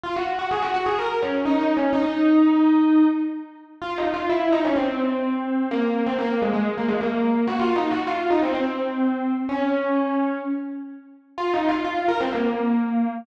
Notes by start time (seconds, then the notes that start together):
0.04 F4
0.16 F#4
0.39 F#4
0.51 G#4
0.62 F#4
0.74 F#4
0.86 G#4
0.99 A#4
1.22 C#4
1.45 D#4
1.61 D#4
1.77 C#4
1.93 D#4
3.82 F4
3.98 D#4
4.14 F4
4.29 E4
4.52 D#4
4.65 C#4
4.76 C4
5.71 A#3
6.06 C4
6.19 A#3
6.42 G#3
6.53 G#3
6.77 A#3
6.88 G#3
7.01 A#3
7.47 F#4
7.59 F4
7.76 D#4
7.91 F#4
8.07 F4
8.30 D#4
8.43 C4
8.54 C4
9.49 C#4
11.38 F4
11.53 D#4
11.69 F4
11.84 F4
12.08 A#4
12.20 C4
12.33 A#3